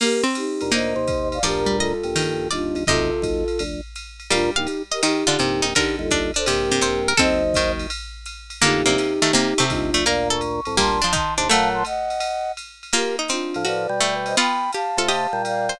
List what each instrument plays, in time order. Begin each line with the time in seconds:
0.00 harpsichord A#3, flute G4 A#4, crash, ride
0.24 harpsichord C4
0.35 flute D#4 G4, hi-hat pedal, ride
0.61 drawbar organ D2 A#2, ride
0.71 harpsichord A#3 D#4, flute C5 D#5, ride
0.96 drawbar organ D#2 C3
1.07 kick, hi-hat pedal, ride
1.32 flute D5 F5, ride
1.43 drawbar organ D2 A#2, harpsichord F3 D5, flute G4 A#4, ride
1.66 harpsichord G3
1.79 flute F4 A4, harpsichord D#5, hi-hat pedal, ride
2.03 drawbar organ A#1 G2, ride
2.16 harpsichord D#3, ride
2.51 drawbar organ G1 D#2, flute D4 F4, harpsichord D5, hi-hat pedal, ride
2.75 drawbar organ G1 D#2, ride
2.87 drawbar organ F#1 D#2, harpsichord C3 D#5, flute F4 A4, kick, ride
3.22 drawbar organ F#1 D#2, kick, hi-hat pedal, ride
3.48 ride
3.59 drawbar organ F1 D2, ride
3.96 hi-hat pedal, ride
4.20 ride
4.30 drawbar organ D2 A#2, harpsichord G3 F5, flute D4 F4, ride
4.56 drawbar organ A#1 G2, flute D#4 G4, harpsichord F5
4.67 hi-hat pedal, ride
4.91 flute G4 A#4, harpsichord D#5, ride
5.03 harpsichord D#3 D#4, flute D#4 G4, ride
5.27 harpsichord D3 F4
5.39 drawbar organ A#1 G2, harpsichord C3, hi-hat pedal, ride
5.62 drawbar organ A#1 G2, harpsichord D#4, ride
5.75 harpsichord D3 A#4, flute D#4 G4, kick, ride
5.99 drawbar organ G1 D#2, flute F4 A4
6.11 harpsichord D4, kick, hi-hat pedal, ride
6.34 harpsichord D4, flute A4 C5, ride
6.45 drawbar organ A#1 G2, harpsichord C3, flute G4 A#4, ride
6.71 harpsichord C3
6.81 harpsichord C3 C5, hi-hat pedal, ride
7.08 harpsichord A#4, ride
7.17 drawbar organ F#1 D#2, harpsichord C4 A4, flute C5 D#5, kick, ride
7.54 harpsichord D#3, kick, hi-hat pedal, ride
7.79 ride
7.90 ride
8.26 hi-hat pedal, ride
8.50 ride
8.61 drawbar organ A1 F2, harpsichord D3 A#3, flute D#4 G4, ride
8.85 drawbar organ F1 D2, harpsichord C3 A#3
8.98 hi-hat pedal, ride
9.22 harpsichord D#3 A3, ride
9.33 harpsichord C3 A#3, ride
9.58 harpsichord C3 A3
9.70 drawbar organ G1 D#2, flute D4 F4, kick, hi-hat pedal, ride
9.94 drawbar organ F1 D2, harpsichord A3, ride
10.05 drawbar organ D2 A#2, harpsichord A#3 A#4, flute D5 F5, ride
10.30 harpsichord A4, flute C#6
10.41 hi-hat pedal, ride
10.65 drawbar organ C2 A2, ride
10.77 drawbar organ D2 A#2, harpsichord G3 A#3, flute A5 C6, kick, ride
11.02 harpsichord F3 D4
11.13 harpsichord D#3 D#4, flute A5 C6, kick, hi-hat pedal, ride
11.37 drawbar organ D#2 C3, harpsichord D4, flute A5 C6, ride
11.48 drawbar organ A#2 F#3, harpsichord A3, flute F5 A5, ride
11.74 flute A5 C6
11.85 flute D#5 F#5, hi-hat pedal, ride
12.10 ride
12.20 ride
12.57 hi-hat pedal, ride
12.83 ride
12.93 harpsichord A#3 F4, flute G4 A#4, ride
13.19 harpsichord D#4
13.28 harpsichord C4, flute D4 F4, hi-hat pedal, ride
13.54 drawbar organ A2 F3, ride
13.65 harpsichord F#4, flute B4 D5, ride
13.89 drawbar organ B2 G3
14.00 harpsichord A3, hi-hat pedal, ride
14.26 flute C5 D#5, ride
14.37 harpsichord B3 F4, flute G5 B5, ride
14.72 harpsichord G4, flute F5 A5, hi-hat pedal, ride
14.97 drawbar organ C3 A3, harpsichord F4 A4, ride
15.08 harpsichord G4 D#5, ride
15.33 drawbar organ A#2 G3
15.45 flute D5 F5, hi-hat pedal, ride
15.69 harpsichord C5, ride